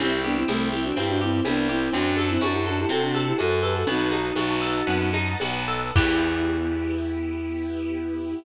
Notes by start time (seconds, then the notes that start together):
0.00 C2 C4 E4 G4 C5 E5 G5, cowbell, low conga, shaker
0.24 B3 D4 G4, high conga, shaker
0.37 C4 E4
0.47 C2 A3 C4 E4, cowbell, high conga, shaker
0.72 C4 E4 G4, high conga, shaker
0.84 D4 F#4
0.96 G2 C4 E4 G4, cowbell, low conga, shaker
1.09 D4 F#4
1.21 C4 E4 G4, shaker
1.32 C4 E4
1.45 C2 B3 D4 E4, cowbell, high conga, shaker
1.68 C4 E4 G4, shaker
1.93 F#2 C4 D4 F#4 C5 F#5 A5, cowbell, low conga, shaker
2.17 A4, high conga, shaker
2.29 C4 E4
2.41 F#2 D4 F#4, cowbell, high conga, shaker
2.53 E4 G4
2.66 D4 F#4 A4, high conga, shaker
2.79 E4 G4
2.89 C3 C4 F#4 A4, cowbell, low conga, shaker
3.02 D4 F#4
3.14 A4, high conga, shaker
3.27 E4 G4
3.38 F#2 F#4 A4, cowbell, high conga, shaker
3.63 G4 A4 B4, shaker
3.74 F#4 A4
3.87 B1 B3 D#4 F#4 B4 D#5 F#5 A5, cowbell, low conga, shaker
4.12 D#4, high conga, shaker
4.36 B1 F#4, cowbell, high conga, shaker
4.61 A4, shaker
4.87 F#2 B3, cowbell, low conga, shaker
5.13 D#4, high conga, shaker
5.39 B1 F#4, cowbell, high conga, shaker
5.68 A4, shaker
5.96 E2 B3 E4 G4, kick, crash